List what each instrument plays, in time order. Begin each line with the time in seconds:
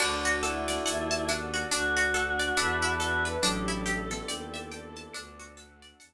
0.00 violin D2, pizzicato strings D4, choir aahs D4, pad 5 (bowed) D4 F#4 A4, tubular bells F#4 D5, electric piano 1 D5, crash, cowbell, claves
0.25 pizzicato strings F#4, shaker
0.43 choir aahs E4, pizzicato strings A4, electric piano 1 F#5, shaker
0.68 pizzicato strings D5, snare, shaker
0.85 violin D#2, pad 5 (bowed) D4 A4 D5, pizzicato strings F#5, electric piano 1 A5, shaker
1.11 pizzicato strings A5, shaker
1.28 pizzicato strings D4, electric piano 1 F#5, snare, claves, shaker
1.54 pizzicato strings F#4, shaker
1.70 violin D2, pad 5 (bowed) D4 F#4 A4, pizzicato strings D4, choir aahs F#4, electric piano 1 D5, cowbell, shaker
1.97 pizzicato strings F#4, shaker
2.14 pizzicato strings A4, electric piano 1 F#5, shaker
2.39 pizzicato strings D5, shaker
2.57 violin E2, pad 5 (bowed) D4 E4 A4 B4, pizzicato strings D4, electric piano 1 D5 E5 A5 B5, cowbell, claves, shaker
2.82 pizzicato strings E4, shaker
2.99 choir aahs F#4, pizzicato strings A4, cowbell, shaker
3.25 pizzicato strings B4, choir aahs B4, shaker
3.42 violin A1, tubular bells F#3 D4, pad 5 (bowed) D4 E4 G4 A4, pizzicato strings D4, choir aahs A4, electric piano 1 D5, cowbell, shaker
3.68 pizzicato strings E4, shaker
3.86 pizzicato strings G4, electric piano 1 E5, shaker
4.10 tubular bells D3 B3, pizzicato strings A4, snare, shaker
4.28 violin D#2, pad 5 (bowed) D4 E4 A4 D5, pizzicato strings D5, electric piano 1 G5, claves, shaker
4.54 pizzicato strings E5, shaker
4.71 pizzicato strings G5, electric piano 1 A5, shaker
4.96 pizzicato strings A5, shaker
5.14 violin D2, pizzicato strings D4, pad 5 (bowed) D4 F#4 A4, electric piano 1 D5, cowbell, claves, shaker
5.39 pizzicato strings F#4, shaker
5.57 pizzicato strings A4, electric piano 1 F#5, shaker
5.82 pizzicato strings D5, shaker
6.00 violin E2, pad 5 (bowed) D4 A4 D5, pizzicato strings F#5, electric piano 1 A5, cowbell, shaker